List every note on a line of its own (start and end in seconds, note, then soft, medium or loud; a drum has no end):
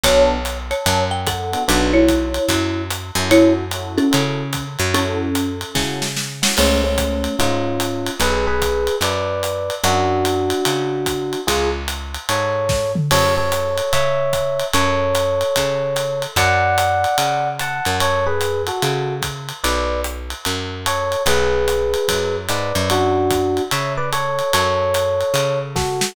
0.03 0.73 B1 medium
0.03 0.36 B3 loud
0.03 0.36 D4 loud
0.03 0.36 F#4 loud
0.03 0.36 A4 loud
0.03 0.57 C#5 medium
0.03 0.57 A5 loud
0.03 kick soft
0.03 ride medium
0.45 hi-hat pedal medium
0.45 ride medium
0.71 1.03 C#5 medium
0.71 1.03 A5 medium
0.71 ride medium
0.86 1.56 F#2 medium
0.86 kick soft
0.86 ride medium
1.11 1.26 G5 medium
1.27 1.63 A4 medium
1.27 1.63 F#5 medium
1.27 kick medium
1.27 hi-hat pedal medium
1.27 ride medium
1.52 1.63 B3 medium
1.52 1.63 D4 medium
1.52 1.63 F#4 medium
1.52 1.63 A4 medium
1.52 ride medium
1.68 2.39 B1 medium
1.68 2.01 B3 loud
1.68 1.93 D4 medium
1.68 2.01 D4 loud
1.68 2.01 F#4 loud
1.68 2.01 A4 loud
1.68 1.93 B4 loud
1.68 ride medium
1.93 2.82 E4 medium
1.93 2.82 C#5 medium
2.08 kick medium
2.08 hi-hat pedal medium
2.08 ride medium
2.34 ride medium
2.49 3.11 F#2 medium
2.49 kick soft
2.49 ride medium
2.90 hi-hat pedal medium
2.90 ride medium
3.15 4.00 F#2 medium
3.15 3.63 C#4 loud
3.15 3.63 E4 medium
3.15 3.63 F#4 loud
3.15 3.63 A4 loud
3.15 ride medium
3.31 3.53 E4 loud
3.31 3.53 C#5 loud
3.31 ride medium
3.71 4.05 C#4 medium
3.71 4.05 E4 medium
3.71 4.05 F#4 medium
3.71 4.05 A4 medium
3.71 hi-hat pedal medium
3.71 ride medium
3.98 4.63 C#4 medium
3.98 4.63 A4 medium
3.98 ride medium
4.11 4.77 C#3 medium
4.11 4.43 C#4 medium
4.11 4.43 E4 medium
4.11 4.43 F#4 medium
4.11 4.43 A4 medium
4.11 ride medium
4.53 kick soft
4.53 hi-hat pedal medium
4.53 ride medium
4.79 5.64 F#2 medium
4.79 ride medium
4.94 5.79 C#4 loud
4.94 5.26 C#4 loud
4.94 5.26 E4 loud
4.94 5.26 F#4 loud
4.94 5.79 A4 loud
4.94 5.26 A4 loud
4.94 ride medium
5.35 hi-hat pedal medium
5.35 ride medium
5.61 ride medium
5.74 6.45 C#3 medium
5.74 6.06 C#4 medium
5.74 6.06 E4 medium
5.74 6.06 F#4 medium
5.74 6.06 A4 medium
5.74 kick medium
5.74 snare medium
6.02 snare medium
6.16 snare medium
6.42 6.53 C#4 medium
6.42 6.53 E4 medium
6.42 6.53 F#4 medium
6.42 6.53 A4 medium
6.42 snare medium
6.57 7.28 C#2 medium
6.57 6.80 A3 medium
6.57 6.80 C#4 medium
6.57 crash medium
6.57 ride medium
6.84 7.35 A3 medium
6.84 7.35 C#4 medium
6.98 kick medium
6.98 hi-hat pedal medium
6.98 ride medium
7.24 ride medium
7.39 8.10 G#2 medium
7.39 8.11 C#4 medium
7.39 8.11 F4 medium
7.39 kick medium
7.39 ride medium
7.80 hi-hat pedal medium
7.80 ride medium
8.07 ride medium
8.20 8.89 B1 medium
8.20 8.45 G#4 medium
8.20 8.45 B4 medium
8.20 ride medium
8.47 8.95 G#4 medium
8.47 8.95 B4 medium
8.62 kick soft
8.62 hi-hat pedal medium
8.62 ride medium
8.87 ride medium
9.01 9.70 F#2 medium
9.01 9.74 B4 medium
9.01 9.74 D5 medium
9.01 ride medium
9.43 hi-hat pedal medium
9.43 ride medium
9.70 ride medium
9.84 10.53 F#2 medium
9.84 11.40 D4 medium
9.84 11.40 F#4 medium
9.84 ride medium
10.25 hi-hat pedal medium
10.25 ride medium
10.50 ride medium
10.65 11.36 C#3 medium
10.65 ride medium
11.06 kick medium
11.06 hi-hat pedal medium
11.06 ride medium
11.33 ride medium
11.47 12.18 C#2 medium
11.47 11.69 F4 medium
11.47 11.69 G#4 medium
11.47 kick soft
11.47 ride medium
11.88 hi-hat pedal medium
11.88 ride medium
12.14 ride medium
12.29 12.99 G#2 medium
12.29 12.92 A4 medium
12.29 12.92 C#5 medium
12.29 ride medium
12.69 kick medium
12.69 snare medium
12.95 mid tom medium
13.11 13.81 F#2 medium
13.11 13.34 A4 medium
13.11 13.34 C#5 medium
13.11 crash medium
13.11 ride medium
13.37 13.92 A4 medium
13.37 13.92 C#5 medium
13.52 hi-hat pedal medium
13.52 ride medium
13.78 ride medium
13.93 14.63 C#3 medium
13.93 14.65 C#5 medium
13.93 14.65 E5 medium
13.93 kick soft
13.93 ride medium
14.33 kick soft
14.33 hi-hat pedal medium
14.33 ride medium
14.60 ride medium
14.73 15.44 F#2 medium
14.73 16.23 A4 medium
14.73 16.23 C#5 medium
14.73 ride medium
15.15 hi-hat pedal medium
15.15 ride medium
15.41 ride medium
15.56 16.27 C#3 medium
15.56 kick soft
15.56 ride medium
15.96 hi-hat pedal medium
15.96 ride medium
16.22 ride medium
16.36 17.06 F#2 medium
16.36 17.49 D5 medium
16.36 17.49 F#5 medium
16.36 kick soft
16.36 ride medium
16.78 hi-hat pedal medium
16.78 ride medium
17.04 ride medium
17.18 17.81 C#3 medium
17.18 ride medium
17.59 17.97 F#5 medium
17.59 17.97 A5 medium
17.59 hi-hat pedal medium
17.59 ride medium
17.85 18.71 F#2 medium
17.85 ride medium
18.00 18.26 A4 medium
18.00 18.26 C#5 medium
18.00 ride medium
18.26 18.62 G#4 medium
18.26 18.62 B4 medium
18.41 hi-hat pedal medium
18.41 ride medium
18.67 19.15 F#4 medium
18.67 19.15 A4 medium
18.67 ride medium
18.82 19.52 C#3 medium
18.82 ride medium
19.22 kick medium
19.22 hi-hat pedal medium
19.22 ride medium
19.49 ride medium
19.64 20.34 B1 medium
19.64 20.01 B4 medium
19.64 20.01 D5 medium
19.64 ride medium
20.04 hi-hat pedal medium
20.30 ride medium
20.45 21.16 F#2 medium
20.45 ride medium
20.86 21.23 A4 medium
20.86 21.23 C#5 medium
20.86 hi-hat pedal medium
20.86 ride medium
21.12 ride medium
21.26 21.95 B1 medium
21.26 22.36 G#4 medium
21.26 22.36 B4 medium
21.26 ride medium
21.68 hi-hat pedal medium
21.68 ride medium
21.94 ride medium
22.08 22.48 F#2 medium
22.08 kick soft
22.08 ride medium
22.49 22.73 G#2 medium
22.49 22.89 B4 medium
22.49 22.89 D5 medium
22.49 hi-hat pedal medium
22.49 ride medium
22.75 23.60 F#2 medium
22.75 ride medium
22.90 23.62 D4 medium
22.90 23.62 F#4 medium
22.90 ride medium
23.31 kick medium
23.31 hi-hat pedal medium
23.31 ride medium
23.57 ride medium
23.71 24.42 C#3 medium
23.71 23.93 C#5 medium
23.71 23.93 E5 medium
23.71 ride medium
23.97 24.10 B4 medium
23.97 24.10 D5 medium
24.13 24.52 A4 medium
24.13 24.52 C#5 medium
24.13 hi-hat pedal medium
24.13 ride medium
24.39 ride medium
24.53 25.23 F#2 medium
24.53 25.59 A4 medium
24.53 25.59 C#5 medium
24.53 ride medium
24.94 hi-hat pedal medium
24.94 ride medium
25.21 ride medium
25.34 26.03 C#3 medium
25.34 ride medium
25.76 26.12 F#4 medium
25.76 26.12 A4 medium
25.76 kick medium
25.76 snare medium
26.01 snare medium